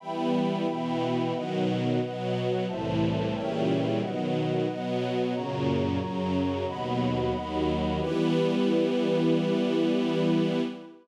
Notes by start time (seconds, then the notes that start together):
0.00 E3 G3 B3 E5 G5 B5
0.67 B2 E3 B3
1.33 B2 D#3 F#3 B4 D#5 F#5
2.01 B2 F#3 B3
2.67 C2 A2 E3 C5 E5 A5
3.33 A#2 C#3 E3 G3 A#4 C#5 E5 G5
4.00 B2 D#3 F#3 B4 D#5 F#5
4.68 B2 F#3 B3
5.33 F#2 A#2 C#3 F#4 C#5 A#5
5.99 F#2 C#3 F#3
6.67 D#2 B2 F#3 D#5 F#5 B5
7.34 D#2 D#3 F#3
8.00 E3 G3 B3 E4 G4 B4